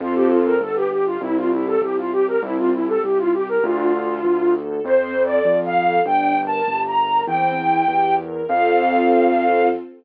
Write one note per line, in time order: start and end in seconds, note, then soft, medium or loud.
0.00 0.56 F2 loud
0.00 0.54 C4 medium
0.00 0.14 F4 loud
0.00 0.54 F4 medium
0.00 0.54 A4 medium
0.15 0.30 G4 medium
0.30 0.45 F4 medium
0.45 0.60 A#4 loud
0.60 1.17 G1 medium
0.60 0.88 B3 medium
0.60 0.75 A4 medium
0.76 0.90 G4 medium
0.91 1.18 G4 medium
0.91 1.05 G4 medium
1.06 1.21 F4 loud
1.21 1.76 C2 loud
1.21 1.48 C4 medium
1.21 1.36 E4 loud
1.36 1.51 F4 medium
1.52 1.66 E4 medium
1.52 1.79 G4 medium
1.67 1.81 A4 medium
1.82 2.36 C2 medium
1.82 2.09 E4 medium
1.82 1.96 G4 medium
1.97 2.11 F4 medium
2.12 2.39 G4 medium
2.12 2.27 G4 loud
2.27 2.42 A#4 medium
2.42 2.97 C2 loud
2.42 2.69 C4 medium
2.42 2.57 E4 loud
2.58 2.72 F4 medium
2.73 2.87 E4 medium
2.73 3.00 G4 medium
2.88 3.02 A4 medium
3.03 3.58 C2 medium
3.03 3.31 E4 medium
3.03 3.18 G4 medium
3.18 3.33 F4 loud
3.33 3.60 G4 medium
3.33 3.48 G4 medium
3.48 3.63 A#4 loud
3.63 4.18 D2 loud
3.63 3.91 D4 medium
3.63 4.52 F4 loud
3.94 4.22 A4 medium
4.24 4.79 D2 medium
4.24 4.52 F4 medium
4.54 4.81 A4 medium
4.84 5.39 F2 loud
4.84 5.12 C4 medium
4.84 5.22 C5 loud
5.15 5.43 A4 medium
5.25 5.58 D5 medium
5.45 6.00 F2 medium
5.45 5.73 F4 medium
5.66 6.01 F5 loud
5.76 6.03 A4 medium
6.06 6.60 G1 loud
6.06 6.33 D4 medium
6.06 6.40 G5 loud
6.37 6.64 A#4 medium
6.47 6.81 A5 loud
6.67 7.22 G1 medium
6.67 6.94 G4 medium
6.87 7.22 A#5 medium
6.97 7.24 A#4 medium
7.27 7.82 E2 medium
7.27 7.55 C4 medium
7.27 8.15 G5 loud
7.57 7.84 E4 medium
7.88 8.43 E2 medium
7.88 8.15 G4 medium
8.18 8.45 A#4 medium
8.48 9.69 F2 loud
8.48 9.68 C4 loud
8.48 9.68 F4 loud
8.48 9.68 A4 medium
8.48 9.68 F5 loud